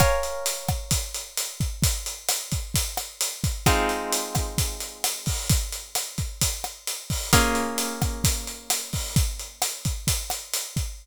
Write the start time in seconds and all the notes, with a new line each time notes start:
0.00 A#4 C#5 F5 G#5, kick, cross-stick, closed hi-hat
0.23 closed hi-hat
0.46 closed hi-hat
0.69 kick, cross-stick, closed hi-hat
0.91 kick, closed hi-hat
1.14 closed hi-hat
1.37 closed hi-hat
1.60 kick, closed hi-hat
1.83 kick, closed hi-hat
2.06 closed hi-hat
2.29 cross-stick, closed hi-hat
2.52 kick, closed hi-hat
2.74 kick, closed hi-hat
2.97 cross-stick, closed hi-hat
3.21 closed hi-hat
3.44 kick, closed hi-hat
3.66 G#3 C4 D#4 F4, kick, cross-stick, closed hi-hat
3.89 closed hi-hat
4.12 closed hi-hat
4.35 kick, cross-stick, closed hi-hat
4.58 kick, closed hi-hat
4.80 closed hi-hat
5.04 cross-stick, closed hi-hat
5.26 kick, open hi-hat
5.49 kick, closed hi-hat
5.72 closed hi-hat
5.95 cross-stick, closed hi-hat
6.18 kick, closed hi-hat
6.42 kick, closed hi-hat
6.64 cross-stick, closed hi-hat
6.87 closed hi-hat
7.10 kick, open hi-hat
7.33 A#3 C#4 F4 G#4, kick, cross-stick, closed hi-hat
7.55 closed hi-hat
7.78 closed hi-hat
8.02 kick, cross-stick, closed hi-hat
8.24 kick, closed hi-hat
8.47 closed hi-hat
8.70 cross-stick, closed hi-hat
8.93 kick, open hi-hat
9.16 kick, closed hi-hat
9.40 closed hi-hat
9.62 cross-stick, closed hi-hat
9.85 kick, closed hi-hat
10.07 kick, closed hi-hat
10.30 cross-stick, closed hi-hat
10.54 closed hi-hat
10.76 kick, closed hi-hat